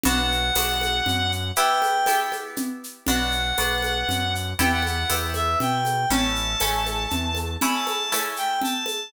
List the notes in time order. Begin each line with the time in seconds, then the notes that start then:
0.03 B1 B3 D4 F#4 F#5, low conga, shaker
0.32 shaker
0.55 B1 B3 D4 F#4, tambourine, high conga, shaker
0.81 high conga, shaker
1.06 F#2, low conga, shaker
1.32 shaker
1.56 B3 E4 G4 G5, shaker
1.82 high conga, shaker
2.06 B3 E4 G4, tambourine, high conga, shaker
2.32 high conga, shaker
2.56 low conga, shaker
2.84 shaker
3.07 B1 B3 D4 F#4 F#5, low conga, shaker
3.31 shaker
3.58 B1 B3 D4 F#4, tambourine, high conga, shaker
3.82 high conga, shaker
4.08 F#2, low conga, shaker
4.35 shaker
4.59 E2 B3 E4 G4 G5, low conga, shaker
4.72 F#5
4.82 F#5, high conga, shaker
5.09 E2 B3 E4 G4, tambourine, high conga, shaker
5.34 E5, high conga, shaker
5.60 B2 G5, low conga, shaker
5.85 high conga, shaker
6.10 A1 A3 C#4 E4 A5, low conga, shaker
6.35 shaker
6.60 A1 A3 C#4 E4, tambourine, high conga, shaker
6.86 high conga, shaker
7.10 E2, low conga, shaker
7.35 high conga, shaker
7.61 A3 C#4 E4 B5, low conga, shaker
7.73 A5
7.87 A5, high conga, shaker
8.12 A3 C#4 E4, tambourine, high conga, shaker
8.36 G5, shaker
8.61 A5, low conga, shaker
8.86 high conga, shaker